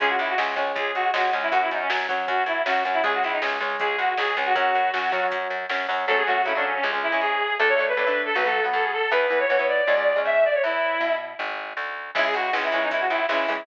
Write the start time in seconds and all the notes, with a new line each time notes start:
0.00 C#2 G#3 C#4 G#4, kick, closed hi-hat
0.09 F#4
0.19 C#2 E4, closed hi-hat
0.29 F#4
0.38 C#2 G#3 C#4, snare
0.56 C#2 G#3 C#4, kick, closed hi-hat
0.75 C#2 G#4, kick, closed hi-hat
0.95 C#2 F#4, closed hi-hat
1.14 C#2 G#3 C#4 F#4, snare
1.33 C#2 G#3 C#4, closed hi-hat
1.42 E4
1.52 F#2 F#3 C#4 F#4, kick, closed hi-hat
1.61 E4
1.71 F#2 D#4, closed hi-hat
1.81 C#4
1.90 F#2 F#3 C#4, snare
2.09 F#2 F#3 C#4, kick, closed hi-hat
2.28 F#2 F#4, kick, closed hi-hat
2.46 F#2 E4, closed hi-hat
2.66 F#2 F#3 C#4 F#4, snare
2.85 F#2 F#3 C#4, closed hi-hat
2.93 E4
3.03 C#2 G#3 C#4 G#4, kick, closed hi-hat
3.14 F#4
3.23 C#2 E4, closed hi-hat
3.32 D#4
3.42 C#2 G#3 C#4, snare
3.60 C#2 G#3 C#4, kick, closed hi-hat
3.79 C#2 G#4, kick, closed hi-hat
3.98 C#2 F#4, closed hi-hat
4.17 C#2 G#3 C#4 G#4, snare
4.37 C#2 G#3 C#4, closed hi-hat
4.45 F#4
4.55 F#2 F#3 C#4 F#4, kick, closed hi-hat
4.75 F#2, closed hi-hat
4.94 F#2 F#3 C#4, snare
5.12 F#2 F#3 C#4, kick, closed hi-hat
5.32 F#2, kick, closed hi-hat
5.50 F#2, closed hi-hat
5.69 F#2 F#3 C#4, snare
5.89 F#2 F#3 C#4, open hi-hat
6.07 F#2 F#3 A3 A4
6.11 C#4
6.17 G#4
6.26 F#3 A3 F#4
6.30 C#4
6.45 C#3 F#3 A3 E4
6.49 C#4
6.55 F#3 A3 C#4 D4
6.65 C#4
6.75 C#4
6.83 C#2 G#3 C#4
6.93 G#3 C#4
7.03 E4
7.12 G#3 C#4
7.21 G#2 G#4
7.59 D2 A3 D4 A4
7.68 C#5
7.79 A3 D4
7.88 B4
7.97 A2 A3 D4
8.07 A3 D4
8.26 A4
8.35 B1 F#3 B3 B4
8.45 F#3 B3 A4
8.64 F#3 B3
8.73 F#2 A4
8.83 G#4
8.93 A4
9.11 E2 E3 B3 B4
9.30 E3 B3
9.40 C#5
9.50 B2 E3 B3
9.59 E3 B3
9.68 D5
9.87 C#2 G#3 C#4
9.97 G#3 C#4
10.16 G#3 C#4
10.25 G#2 E5
10.45 D5
10.54 C#5
10.64 E2 E4
11.00 B2
11.39 G#1
11.77 D2
12.15 C#2 E3 G#3 C#4 E4, kick, crash
12.25 G#4
12.34 C#2 F#4, closed hi-hat
12.53 C#2 E3 G#3 C#4, snare
12.64 E4
12.72 C#2 E3 G#3 C#4 E4, closed hi-hat
12.82 D#4
12.91 C#2 E4, kick, closed hi-hat
13.00 F#4
13.09 C#2 E4, closed hi-hat
13.29 C#2 E3 G#3 C#4 E4, snare
13.48 C#2 E3 G#3 C#4, open hi-hat